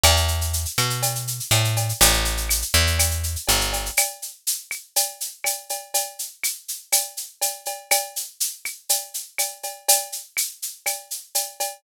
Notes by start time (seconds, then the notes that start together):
0.04 E2, cowbell, claves, shaker
0.16 shaker
0.28 shaker
0.41 shaker
0.53 shaker
0.65 shaker
0.78 B2, claves, shaker
0.90 shaker
1.02 cowbell, shaker
1.15 shaker
1.27 shaker
1.40 shaker
1.51 A2, cowbell, claves, shaker
1.64 shaker
1.77 cowbell, shaker
1.89 shaker
2.01 A1, cowbell, shaker
2.13 shaker
2.25 shaker
2.37 shaker
2.49 claves, shaker
2.62 shaker
2.74 E2, shaker
2.87 shaker
2.99 cowbell, claves, shaker
3.11 shaker
3.23 shaker
3.36 shaker
3.48 G1, cowbell, shaker
3.61 shaker
3.73 cowbell, shaker
3.86 shaker
3.97 cowbell, claves, shaker
4.22 shaker
4.47 shaker
4.71 claves, shaker
4.96 cowbell, shaker
5.21 shaker
5.44 cowbell, claves, shaker
5.69 cowbell, shaker
5.94 cowbell, shaker
6.19 shaker
6.44 claves, shaker
6.68 shaker
6.92 cowbell, claves, shaker
7.17 shaker
7.41 cowbell, shaker
7.66 cowbell, shaker
7.91 cowbell, claves, shaker
8.16 shaker
8.40 shaker
8.65 claves, shaker
8.89 cowbell, shaker
9.14 shaker
9.38 cowbell, claves, shaker
9.63 cowbell, shaker
9.88 cowbell, shaker
10.12 shaker
10.37 claves, shaker
10.62 shaker
10.86 cowbell, claves, shaker
11.11 shaker
11.35 cowbell, shaker
11.60 cowbell, shaker